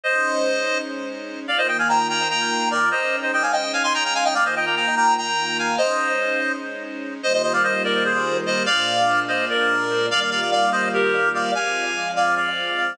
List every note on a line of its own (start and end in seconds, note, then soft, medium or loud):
0.04 1.47 G#3 loud
0.04 1.47 C#4 loud
0.04 1.47 D#4 loud
0.04 0.78 C5 medium
0.04 0.78 D#5 medium
1.48 2.91 D#3 loud
1.48 2.91 A#3 loud
1.48 2.91 F4 medium
1.48 1.57 D5 medium
1.48 1.57 F5 loud
1.58 1.68 C5 medium
1.58 1.67 D#5 loud
1.68 1.77 D#5 medium
1.68 1.77 G5 medium
1.79 1.88 F5 medium
1.79 1.88 G#5 medium
1.89 2.07 G5 medium
1.89 2.07 A#5 medium
2.09 2.28 G5 medium
2.09 2.28 A#5 medium
2.30 2.69 G5 medium
2.30 2.69 A#5 medium
2.71 2.89 A#4 medium
2.71 2.89 D5 medium
2.91 4.35 G#3 loud
2.91 4.35 C#4 medium
2.91 4.35 D#4 medium
2.91 3.16 C5 medium
2.91 3.16 D#5 medium
3.22 3.32 C5 medium
3.22 3.32 D#5 medium
3.33 3.43 D#5 medium
3.33 3.43 G5 medium
3.42 3.52 F5 medium
3.42 3.52 G#5 medium
3.52 3.72 D#5 medium
3.52 3.72 G5 medium
3.73 3.83 F5 medium
3.73 3.83 G#5 medium
3.83 3.93 G#5 medium
3.83 3.93 C6 loud
3.94 4.04 G5 medium
3.94 4.04 A#5 medium
4.04 4.14 G5 medium
4.04 4.14 A#5 medium
4.15 4.24 F5 medium
4.15 4.24 G#5 loud
4.24 4.34 D#5 medium
4.24 4.34 G5 medium
4.34 5.77 D#3 medium
4.34 5.77 A#3 loud
4.34 5.77 F4 medium
4.34 4.44 D5 medium
4.34 4.44 F5 medium
4.45 4.55 C5 medium
4.45 4.55 D#5 medium
4.56 4.66 D#5 medium
4.56 4.65 G5 medium
4.66 4.75 G5 medium
4.66 4.75 A#5 medium
4.76 4.95 G5 medium
4.76 4.95 A#5 medium
4.96 5.14 G5 medium
4.96 5.14 A#5 medium
5.17 5.57 G5 medium
5.17 5.57 A#5 medium
5.59 5.76 F5 medium
5.59 5.76 G#5 medium
5.78 7.21 G#3 loud
5.78 7.21 C#4 loud
5.78 7.21 D#4 loud
5.78 6.52 C5 medium
5.78 6.52 D#5 medium
7.22 8.65 D#3 loud
7.22 8.65 G3 loud
7.22 8.65 A#3 loud
7.22 8.65 F4 loud
7.22 7.33 C5 medium
7.22 7.33 D#5 medium
7.34 7.42 C5 medium
7.34 7.42 D#5 medium
7.43 7.53 C5 medium
7.43 7.53 D#5 medium
7.53 7.63 D5 medium
7.53 7.63 F5 medium
7.63 7.83 C5 medium
7.63 7.83 D#5 medium
7.84 8.04 A#4 medium
7.84 8.04 D5 medium
8.04 8.37 G#4 medium
8.04 8.37 C5 medium
8.46 8.63 C5 medium
8.46 8.63 D#5 medium
8.66 10.09 A#2 loud
8.66 10.09 G#3 medium
8.66 10.09 D4 loud
8.66 10.08 F4 medium
8.66 9.20 D5 loud
8.66 9.20 F5 loud
9.28 9.45 C5 medium
9.28 9.45 D#5 medium
9.50 10.06 A#4 medium
9.50 10.06 D5 medium
10.09 11.51 D#3 medium
10.09 11.51 G3 loud
10.09 11.51 A#3 loud
10.09 11.51 F4 medium
10.09 10.20 D5 loud
10.09 10.20 F5 loud
10.20 10.30 D5 medium
10.20 10.30 F5 medium
10.31 10.40 D5 medium
10.31 10.40 F5 medium
10.41 10.51 D5 medium
10.41 10.51 F5 medium
10.52 10.70 D5 medium
10.52 10.70 F5 medium
10.72 10.89 C5 medium
10.72 10.89 D#5 medium
10.94 11.29 G4 medium
10.94 11.29 A#4 medium
11.35 11.51 D5 medium
11.35 11.51 F5 medium
11.55 12.97 F3 loud
11.55 12.97 G#3 loud
11.55 12.97 C4 medium
11.55 12.09 F5 medium
11.55 12.09 G#5 medium
12.16 12.35 D5 medium
12.16 12.35 F5 medium
12.36 12.93 D5 medium
12.36 12.93 F5 medium